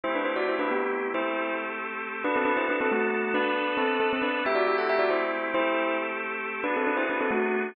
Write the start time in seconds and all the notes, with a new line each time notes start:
0.03 A3 C4 E4 G4 C5
0.15 D4 B4
0.25 E4 C5
0.36 F#4 D5
0.49 E4 C5
0.59 D4 B4
0.71 B3 G4
1.14 A3 C4 E4 G4 A4 C5
2.24 B3 D4 F#4 A4 B4
2.36 C4 A4
2.45 D4 B4
2.57 E4 C5
2.69 D4 B4
2.81 C4 A4
2.91 A3 F#4
3.34 B3 D4 A4 B4
3.77 C4 A4
4.00 C4 A4
4.13 C4 A4
4.22 D4 B4
4.45 A3 C4 E4 G4 E5
4.55 F#4 D5
4.67 G4 E5
4.78 A4 F#5
4.89 G4 E5
4.99 F#4 D5
5.10 E4 C5
5.54 A3 C4 E4 G4 A4 C5
6.64 B3 D4 F#4 G#4 B4
6.76 C4 A4
6.87 D4 B4
6.97 E4 C5
7.10 D4 B4
7.21 C4 A4
7.31 A3 F#4